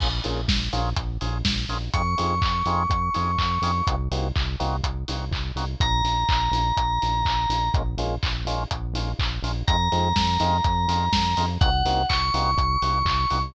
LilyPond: <<
  \new Staff \with { instrumentName = "Electric Piano 2" } { \time 4/4 \key bes \minor \tempo 4 = 124 r1 | des'''1 | r1 | bes''1 |
r1 | bes''1 | ges''4 des'''2. | }
  \new Staff \with { instrumentName = "Drawbar Organ" } { \time 4/4 \key bes \minor <bes des' f' aes'>8 <bes des' f' aes'>4 <bes des' f' aes'>4 <bes des' f' aes'>4 <bes des' f' aes'>8 | <c' ees' f' aes'>8 <c' ees' f' aes'>4 <c' ees' f' aes'>4 <c' ees' f' aes'>4 <c' ees' f' aes'>8 | <bes c' ees' ges'>8 <bes c' ees' ges'>4 <bes c' ees' ges'>4 <bes c' ees' ges'>4 <bes c' ees' ges'>8 | r1 |
<aes bes des' f'>8 <aes bes des' f'>4 <aes bes des' f'>4 <aes bes des' f'>4 <aes bes des' f'>8 | <aes c' ees' f'>8 <aes c' ees' f'>4 <aes c' ees' f'>4 <aes c' ees' f'>4 <aes c' ees' f'>8 | <bes c' ees' ges'>8 <bes c' ees' ges'>4 <bes c' ees' ges'>4 <bes c' ees' ges'>4 <bes c' ees' ges'>8 | }
  \new Staff \with { instrumentName = "Synth Bass 1" } { \clef bass \time 4/4 \key bes \minor bes,,8 bes,,8 bes,,8 bes,,8 bes,,8 bes,,8 bes,,8 bes,,8 | f,8 f,8 f,8 f,8 f,8 f,8 f,8 f,8 | c,8 c,8 c,8 c,8 c,8 c,8 c,8 c,8 | bes,,8 bes,,8 bes,,8 bes,,8 bes,,8 bes,,8 bes,,8 bes,,8 |
bes,,8 bes,,8 bes,,8 bes,,8 bes,,8 bes,,8 bes,,8 bes,,8 | f,8 f,8 f,8 f,8 f,8 f,8 f,8 f,8 | c,8 c,8 c,8 c,8 c,8 c,8 c,8 c,8 | }
  \new DrumStaff \with { instrumentName = "Drums" } \drummode { \time 4/4 <cymc bd>8 hho8 <bd sn>8 hho8 <hh bd>8 hho8 <bd sn>8 hho8 | <hh bd>8 hho8 <hc bd>8 hho8 <hh bd>8 hho8 <hc bd>8 hho8 | <hh bd>8 hho8 <hc bd>8 hho8 <hh bd>8 hho8 <hc bd>8 hho8 | <hh bd>8 hho8 <hc bd>8 hho8 <hh bd>8 hho8 <hc bd>8 hho8 |
<hh bd>8 hho8 <hc bd>8 hho8 <hh bd>8 hho8 <hc bd>8 hho8 | <hh bd>8 hho8 <bd sn>8 hho8 <hh bd>8 hho8 <bd sn>8 hho8 | <hh bd>8 hho8 <hc bd>8 hho8 <hh bd>8 hho8 <hc bd>8 hho8 | }
>>